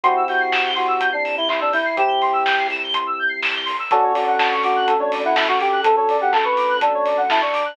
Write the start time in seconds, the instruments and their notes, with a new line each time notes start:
0.03 synth bass 1 C2, electric piano 1 C4 E4 G4, lead 1 (square) F#4 C6, kick, closed hi-hat
0.16 lead 1 (square) E6
0.28 lead 1 (square) F#4 G6, open hi-hat
0.40 lead 1 (square) C7
0.52 lead 1 (square) E7, kick, snare
0.65 lead 1 (square) G7
0.76 lead 1 (square) F#4 C6, open hi-hat
0.88 lead 1 (square) E6
1.00 lead 1 (square) G6, kick, closed hi-hat
1.12 lead 1 (square) D4 C7
1.24 lead 1 (square) E7, open hi-hat
1.37 lead 1 (square) E4 G7
1.49 lead 1 (square) E4 C6, kick, clap
1.60 lead 1 (square) D4 E6
1.72 lead 1 (square) E4 G6, open hi-hat
1.85 lead 1 (square) C7
1.97 synth bass 1 C2, electric piano 1 C4 E4 G4, lead 1 (square) G4 E7, kick, closed hi-hat
2.08 lead 1 (square) G7
2.22 lead 1 (square) C6, open hi-hat
2.33 lead 1 (square) E6
2.45 lead 1 (square) G6, kick, snare
2.58 lead 1 (square) C7
2.70 lead 1 (square) E7, open hi-hat
2.83 lead 1 (square) G7
2.94 lead 1 (square) C6, kick, closed hi-hat
3.07 lead 1 (square) E6
3.19 lead 1 (square) G6
3.29 lead 1 (square) C7
3.42 lead 1 (square) E7, kick, snare, open hi-hat
3.55 lead 1 (square) G7
3.65 lead 1 (square) C6, open hi-hat
3.79 lead 1 (square) E6
3.91 synth bass 1 D2, electric piano 1 C#4 D4 F#4 A4, lead 1 (square) F#4 A4, kick, closed hi-hat
4.03 lead 1 (square) C#5
4.14 lead 1 (square) F#4 D5, open hi-hat
4.27 lead 1 (square) F#5
4.39 lead 1 (square) A5, kick, snare
4.51 lead 1 (square) C#6
4.63 lead 1 (square) F#4 D6, open hi-hat
4.76 lead 1 (square) F#6
4.87 lead 1 (square) A4, kick, closed hi-hat
4.99 lead 1 (square) D4 C#5
5.12 lead 1 (square) D5, open hi-hat
5.24 lead 1 (square) E4 F#5
5.35 lead 1 (square) E4 A5, kick, snare
5.47 lead 1 (square) F#4 C#6
5.60 lead 1 (square) G4 D6, open hi-hat
5.72 lead 1 (square) F#6
5.83 synth bass 1 D2, lead 1 (square) A4, kick, closed hi-hat
5.96 lead 1 (square) A4 C#5
6.09 lead 1 (square) D5, open hi-hat
6.21 lead 1 (square) G4 F#5
6.32 lead 1 (square) A4 A5, kick, clap
6.44 lead 1 (square) B4 C#6
6.57 lead 1 (square) D6, open hi-hat
6.69 lead 1 (square) F#6
6.80 lead 1 (square) D4 A4, kick, closed hi-hat
6.94 lead 1 (square) C#5
7.05 lead 1 (square) D5, open hi-hat
7.17 lead 1 (square) F#5
7.30 lead 1 (square) E4 A5, kick, snare
7.41 lead 1 (square) D4 C#6
7.53 lead 1 (square) D6, open hi-hat
7.65 lead 1 (square) F#6